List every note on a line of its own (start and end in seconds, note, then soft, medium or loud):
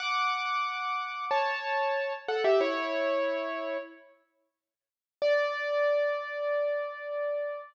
0.00 1.25 F#5 medium
0.00 1.25 D6 loud
1.31 2.13 C#5 medium
1.31 2.13 A5 medium
2.28 2.44 A4 medium
2.28 2.44 F#5 medium
2.44 2.60 G4 medium
2.44 2.60 E5 medium
2.61 3.77 E4 medium
2.61 3.77 C#5 medium
5.22 7.61 D5 loud